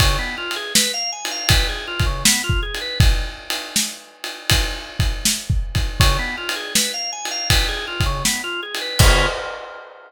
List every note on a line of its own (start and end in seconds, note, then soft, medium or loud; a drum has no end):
0.00 0.17 C#3 loud
0.00 kick medium
0.00 ride loud
0.19 0.36 B3 medium
0.38 0.54 F4 medium
0.51 ride medium
0.56 0.73 G#4 medium
0.75 0.92 B4 loud
0.75 snare loud
0.94 1.11 F5 loud
1.12 1.29 G#5 medium
1.25 ride medium
1.31 1.48 F5 medium
1.49 1.67 B4 medium
1.49 kick medium
1.49 ride loud
1.69 1.86 G#4 medium
1.88 2.04 F4 medium
2.00 kick medium
2.00 ride medium
2.06 2.23 C#3 medium
2.25 2.42 B3 medium
2.25 snare loud
2.44 2.61 F4 medium
2.50 kick medium
2.63 2.79 G#4 medium
2.75 ride medium
2.81 2.98 B4 medium
3.00 kick loud
3.00 ride medium
3.50 ride medium
3.76 snare medium
4.24 ride medium
4.50 kick medium
4.50 ride loud
5.00 kick medium
5.00 ride medium
5.25 snare medium
5.50 kick medium
5.75 kick medium
5.75 ride medium
6.00 6.17 C#3 loud
6.00 kick medium
6.00 ride medium
6.19 6.36 B3 medium
6.38 6.54 F4 medium
6.49 ride medium
6.56 6.73 G#4 medium
6.75 6.92 B4 medium
6.75 snare loud
6.94 7.11 F5 medium
7.12 7.29 G#5 medium
7.25 ride medium
7.31 7.48 F5 medium
7.50 7.67 B4 medium
7.50 kick medium
7.50 ride loud
7.69 7.86 G#4 medium
7.87 8.04 F4 medium
8.00 kick medium
8.00 ride medium
8.06 8.23 C#3 medium
8.25 8.42 B3 medium
8.25 snare medium
8.44 8.61 F4 medium
8.63 8.80 G#4 medium
8.75 ride medium
8.81 8.98 B4 medium
8.99 9.26 C#3 loud
8.99 9.26 B3 loud
8.99 9.26 F4 loud
8.99 9.26 G#4 medium
8.99 kick loud
8.99 crash loud